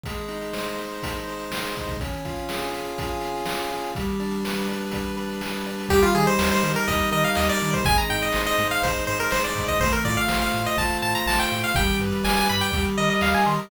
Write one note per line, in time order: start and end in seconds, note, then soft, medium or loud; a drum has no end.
0.03 0.78 G#3 medium
0.03 kick loud
0.03 closed hi-hat loud
0.17 closed hi-hat medium
0.28 1.03 D#4 medium
0.28 closed hi-hat medium
0.41 closed hi-hat medium
0.53 1.27 C5 medium
0.53 snare loud
0.65 closed hi-hat medium
0.78 1.50 G#3 medium
0.78 closed hi-hat medium
0.92 closed hi-hat medium
1.03 1.76 D#4 medium
1.03 kick medium
1.03 closed hi-hat loud
1.16 closed hi-hat medium
1.27 1.97 C5 medium
1.27 closed hi-hat medium
1.39 closed hi-hat medium
1.51 1.97 G#3 medium
1.51 snare loud
1.63 snare medium
1.63 closed hi-hat medium
1.74 1.99 D#4 medium
1.74 kick medium
1.74 closed hi-hat medium
1.87 kick loud
1.87 closed hi-hat medium
1.99 2.72 C#4 medium
1.99 kick loud
1.99 closed hi-hat loud
2.13 closed hi-hat medium
2.25 2.99 F4 medium
2.25 kick medium
2.25 closed hi-hat medium
2.36 closed hi-hat medium
2.49 3.20 G#4 medium
2.49 snare loud
2.62 closed hi-hat medium
2.72 3.46 C#4 medium
2.72 closed hi-hat medium
2.85 closed hi-hat medium
2.98 3.71 F4 medium
2.98 kick loud
2.98 closed hi-hat loud
3.10 closed hi-hat medium
3.21 3.90 G#4 medium
3.21 closed hi-hat medium
3.35 closed hi-hat medium
3.46 3.92 C#4 medium
3.46 snare loud
3.59 snare medium
3.59 closed hi-hat medium
3.71 3.94 F4 medium
3.71 closed hi-hat medium
3.83 closed hi-hat medium
3.95 4.68 G3 medium
3.95 kick loud
3.95 closed hi-hat loud
4.08 closed hi-hat medium
4.19 4.93 D4 medium
4.19 closed hi-hat medium
4.31 closed hi-hat medium
4.45 5.16 B4 medium
4.45 snare loud
4.58 closed hi-hat medium
4.69 5.41 G3 medium
4.69 closed hi-hat medium
4.81 closed hi-hat medium
4.91 5.66 D4 medium
4.91 kick medium
4.91 closed hi-hat loud
5.05 closed hi-hat medium
5.17 5.86 B4 medium
5.17 closed hi-hat medium
5.29 closed hi-hat medium
5.41 5.88 G3 medium
5.41 snare loud
5.53 snare medium
5.53 closed hi-hat medium
5.66 5.90 D4 medium
5.66 closed hi-hat medium
5.80 closed hi-hat medium
5.89 6.04 D#2 loud
5.89 6.63 G3 loud
5.89 6.02 G4 medium
5.89 kick loud
5.89 closed hi-hat loud
6.02 6.14 F4 medium
6.02 closed hi-hat medium
6.15 6.28 D#3 medium
6.15 6.88 D#4 medium
6.15 6.26 G#4 medium
6.15 closed hi-hat medium
6.27 6.50 C5 medium
6.27 closed hi-hat medium
6.39 6.52 D#2 medium
6.39 7.11 A#4 medium
6.39 snare loud
6.52 6.72 C5 medium
6.52 closed hi-hat medium
6.63 6.76 D#3 medium
6.63 7.38 G3 medium
6.63 closed hi-hat loud
6.74 6.87 A#4 medium
6.74 closed hi-hat medium
6.88 7.01 D#2 medium
6.88 7.61 D#4 medium
6.88 7.10 D#5 medium
6.88 kick loud
6.88 closed hi-hat loud
6.99 closed hi-hat medium
7.11 7.25 D#3 medium
7.11 7.81 A#4 medium
7.11 7.24 D#5 medium
7.11 closed hi-hat medium
7.23 7.36 F5 medium
7.23 closed hi-hat medium
7.35 7.50 D#2 loud
7.35 7.85 G3 medium
7.35 7.48 D#5 medium
7.35 snare loud
7.48 7.71 D5 medium
7.48 snare medium
7.48 closed hi-hat medium
7.60 7.75 D#3 medium
7.60 7.84 D#4 medium
7.60 closed hi-hat medium
7.73 7.85 C5 medium
7.73 kick medium
7.73 closed hi-hat medium
7.84 7.99 G#1 loud
7.84 8.59 G#3 medium
7.84 7.97 G#5 medium
7.84 kick loud
7.84 closed hi-hat loud
7.97 8.09 A#5 medium
7.97 closed hi-hat medium
8.09 8.24 G#2 medium
8.09 8.83 D#4 medium
8.09 8.21 G5 medium
8.09 closed hi-hat medium
8.21 8.42 D#5 medium
8.21 closed hi-hat medium
8.32 8.48 G#1 medium
8.32 9.08 C5 medium
8.32 snare loud
8.46 8.68 D#5 medium
8.46 closed hi-hat medium
8.58 8.72 G#2 medium
8.58 9.32 G#3 medium
8.58 closed hi-hat loud
8.71 8.83 F5 medium
8.71 closed hi-hat medium
8.82 8.96 G#1 medium
8.82 9.55 D#4 medium
8.82 9.05 C5 medium
8.82 kick loud
8.82 closed hi-hat loud
8.95 closed hi-hat medium
9.07 9.21 G#2 loud
9.07 9.19 C5 medium
9.07 9.78 C5 medium
9.07 closed hi-hat medium
9.19 9.31 A#4 medium
9.19 closed hi-hat medium
9.31 9.45 G#1 medium
9.31 9.79 G#3 medium
9.31 9.43 C5 medium
9.31 snare loud
9.43 9.65 D5 medium
9.43 snare medium
9.43 closed hi-hat medium
9.55 9.69 G#2 medium
9.55 9.78 D#4 medium
9.55 kick loud
9.55 closed hi-hat loud
9.67 9.80 D#5 medium
9.67 kick medium
9.67 closed hi-hat medium
9.80 9.94 A1 loud
9.80 10.53 A3 medium
9.80 9.92 C5 medium
9.80 kick loud
9.80 closed hi-hat loud
9.92 10.04 A#4 medium
9.92 closed hi-hat medium
10.05 10.19 A2 loud
10.05 10.76 F4 medium
10.05 10.16 D5 medium
10.05 kick loud
10.05 closed hi-hat loud
10.17 10.37 F5 medium
10.17 closed hi-hat medium
10.28 10.43 A1 loud
10.28 11.02 C5 medium
10.28 snare loud
10.40 10.63 F5 medium
10.40 closed hi-hat medium
10.54 10.67 A2 medium
10.54 11.26 A3 medium
10.54 closed hi-hat medium
10.65 10.78 D#5 medium
10.65 closed hi-hat medium
10.77 10.91 A1 medium
10.77 11.51 F4 medium
10.77 10.98 A5 medium
10.77 kick loud
10.77 closed hi-hat loud
10.90 closed hi-hat medium
11.02 11.16 A2 medium
11.02 11.72 C5 medium
11.02 11.14 A5 medium
11.02 closed hi-hat medium
11.15 11.26 A#5 medium
11.15 closed hi-hat medium
11.26 11.40 A1 loud
11.26 11.73 A3 medium
11.26 11.39 A5 medium
11.26 snare loud
11.39 11.59 G5 medium
11.39 snare medium
11.39 closed hi-hat medium
11.52 11.65 A2 medium
11.52 11.75 F4 medium
11.52 closed hi-hat medium
11.64 11.75 F5 medium
11.64 closed hi-hat medium
11.74 11.89 G1 loud
11.74 12.48 G3 medium
11.74 11.97 G5 medium
11.74 kick loud
11.74 closed hi-hat loud
11.89 closed hi-hat medium
12.00 12.13 G2 medium
12.00 12.71 B4 medium
12.00 closed hi-hat medium
12.12 closed hi-hat medium
12.24 12.38 G1 loud
12.24 12.70 D5 medium
12.24 12.36 G#5 medium
12.24 snare loud
12.36 12.48 G#5 medium
12.36 closed hi-hat medium
12.48 12.64 G2 medium
12.48 12.72 G3 medium
12.48 12.61 B5 medium
12.48 closed hi-hat medium
12.61 12.83 G5 medium
12.61 closed hi-hat medium
12.72 12.86 D#2 loud
12.72 13.45 G3 medium
12.72 kick loud
12.72 closed hi-hat loud
12.85 closed hi-hat medium
12.97 13.10 D#3 medium
12.97 13.69 A#4 medium
12.97 13.09 D#5 medium
12.97 closed hi-hat medium
13.10 13.21 D#5 medium
13.10 closed hi-hat medium
13.21 13.35 D#2 medium
13.21 13.69 D#5 medium
13.21 13.34 F5 medium
13.21 snare loud
13.34 13.46 G#5 medium
13.34 snare medium
13.34 closed hi-hat medium
13.46 13.60 D#3 medium
13.46 13.69 G3 medium
13.46 13.58 C6 medium
13.46 closed hi-hat medium
13.58 13.70 A#5 medium
13.58 closed hi-hat medium